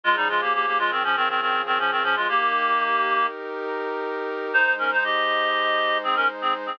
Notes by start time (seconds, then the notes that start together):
0.04 C#3 F3 G#3 F4 G#4
0.16 G3 D#4
0.29 G#3 F4
0.41 A#3 G4
0.54 A#3 G4
0.66 A#3 G4
0.79 G#3 F4
0.91 D#3 C4
1.04 F3 C#4
1.16 D#3 C4
1.29 D#3 C4
1.41 D#3 C4
1.66 D#3 C4
1.79 F3 C#4
1.91 D#3 C4
2.03 F3 C#4
2.16 G#3 F4
2.28 A#3 D#4 G4 A#4
4.53 G#3 D#4 C5
4.78 C#4 A#4
4.91 D#4 C5
5.04 G4 D#5
6.03 C4 G#4
6.16 C#4 A#4
6.41 C4 G#4
6.66 C4 G#4